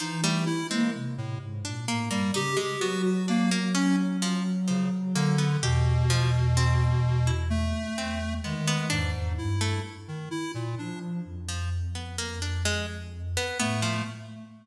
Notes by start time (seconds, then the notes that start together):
0.00 E3 F3 D#4
0.23 G3 A3
0.46 E4
0.70 G#3 A#3 C4
0.94 C3
1.18 A2
1.41 G#2
1.64 A#2 D4
1.88 A2 A#3
2.10 G2 G3 A#3
2.34 C#3 D#4 G4
2.57 G#3 G4
2.81 F#3 B3 F#4
3.05 F#4
3.28 A#3 D4
3.51 A#3
3.75 C#4
4.22 F3
4.68 C#3 F3
5.15 D3 A#3
5.38 B3
5.62 E2 B2 G4
6.10 F3
6.57 C4
7.27 E4
7.50 A3
7.97 E2 C4
8.44 D#3 G#3 B3
8.68 B3
8.90 E2 G#2 D4
9.14 E2
9.38 G2 E4
9.61 A3
10.08 D#3
10.31 E4
10.54 A#2
10.78 F3 D4
11.25 F2
11.48 F3
11.95 B3
12.18 A#3
12.42 D4
12.65 G#3
13.37 B3
13.59 A2 A3 B3
13.82 F3